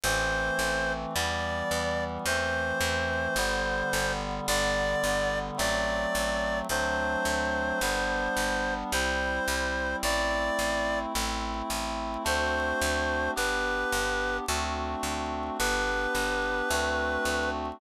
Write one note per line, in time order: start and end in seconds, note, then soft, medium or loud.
0.03 0.51 A1 loud
0.03 1.14 E3 medium
0.03 1.14 A3 medium
0.03 1.14 C4 medium
0.03 0.93 C5 medium
0.59 1.06 A1 medium
1.15 1.63 E2 loud
1.15 2.26 E3 medium
1.15 2.26 G3 medium
1.15 2.26 B3 medium
1.15 2.04 D5 medium
1.71 2.18 E2 medium
2.25 2.73 E2 medium
2.25 3.37 E3 medium
2.25 3.37 A3 medium
2.25 3.37 C4 medium
2.25 4.12 C5 medium
2.81 3.28 E2 medium
3.36 3.83 G1 medium
3.36 4.47 D3 medium
3.36 4.47 G3 medium
3.36 4.47 B3 medium
3.93 4.40 G1 medium
4.47 4.95 G1 loud
4.47 5.57 D3 medium
4.47 5.57 G3 medium
4.47 5.57 B3 medium
4.47 5.39 D5 medium
5.03 5.51 G1 medium
5.57 6.06 A1 medium
5.57 6.67 F#3 medium
5.57 6.67 A3 medium
5.57 6.67 C4 medium
5.57 6.59 D5 medium
6.15 6.62 A1 medium
6.69 7.16 D2 medium
6.69 7.80 F#3 medium
6.69 7.80 A3 medium
6.69 7.80 C4 medium
6.69 7.80 D4 medium
6.69 8.74 C5 medium
7.25 7.72 D2 medium
7.81 8.28 G1 medium
7.81 8.92 G3 medium
7.81 8.92 B3 medium
7.81 8.92 D4 medium
8.37 8.84 G1 medium
8.92 9.40 C2 loud
8.92 10.03 G3 medium
8.92 10.03 C4 medium
8.92 10.03 E4 medium
8.92 9.96 C5 medium
9.48 9.95 C2 medium
10.03 10.50 A1 medium
10.03 11.13 A3 medium
10.03 11.13 C4 medium
10.03 11.13 E4 medium
10.03 10.99 D5 medium
10.59 11.06 A1 medium
11.14 11.62 A1 medium
11.14 12.24 A3 medium
11.14 12.24 C4 medium
11.14 12.24 E4 medium
11.70 12.17 A1 medium
12.24 12.73 D2 medium
12.24 13.34 A3 medium
12.24 13.34 C4 medium
12.24 13.34 D4 medium
12.24 13.34 F#4 medium
12.24 13.31 C5 medium
12.81 13.29 D2 medium
13.35 13.84 G1 medium
13.35 14.45 B3 medium
13.35 14.45 D4 medium
13.35 14.45 G4 medium
13.35 14.37 B4 medium
13.92 14.40 G1 medium
14.48 14.96 D2 medium
14.48 15.58 A3 medium
14.48 15.58 C4 medium
14.48 15.58 D4 medium
14.48 15.58 F#4 medium
15.03 15.50 D2 medium
15.59 16.07 G1 medium
15.59 16.69 B3 medium
15.59 16.69 D4 medium
15.59 16.69 G4 medium
15.59 17.50 B4 medium
16.15 16.62 G1 medium
16.69 17.18 D2 medium
16.69 17.79 A3 medium
16.69 17.79 C4 medium
16.69 17.79 D4 medium
16.69 17.79 F#4 medium
17.25 17.72 D2 medium